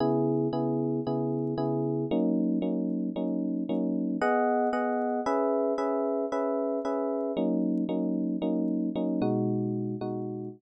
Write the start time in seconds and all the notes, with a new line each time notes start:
0.00 C#3 B3 E4 G#4
0.53 C#3 B3 E4 G#4
1.07 C#3 B3 E4 G#4
1.58 C#3 B3 E4 G#4
2.11 F#3 A#3 C#4 D#4
2.62 F#3 A#3 C#4 D#4
3.16 F#3 A#3 C#4 D#4
3.69 F#3 A#3 C#4 D#4
4.21 B3 G#4 D#5 F#5
4.73 B3 G#4 D#5 F#5
5.26 C#4 G#4 B4 E5
5.78 C#4 G#4 B4 E5
6.32 C#4 G#4 B4 E5
6.85 C#4 G#4 B4 E5
7.37 F#3 A#3 C#4 D#4
7.89 F#3 A#3 C#4 D#4
8.42 F#3 A#3 C#4 D#4
8.96 F#3 A#3 C#4 D#4
9.22 B2 G#3 D#4 F#4
10.01 B2 G#3 D#4 F#4